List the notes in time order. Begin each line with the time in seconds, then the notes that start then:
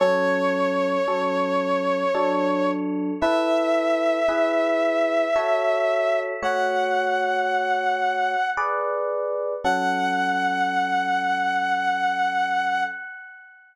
0.00 F#3 C#4 A4 C#5
1.08 F#3 C#4 A4
2.15 F#3 D4 A4
3.21 E4 A4 B4 E5
4.28 E4 G#4 B4
5.36 F#4 A4 C#5
6.42 A3 F#4 C#5 F#5
8.57 G#4 B4 D5
9.64 F#3 C#4 A4 F#5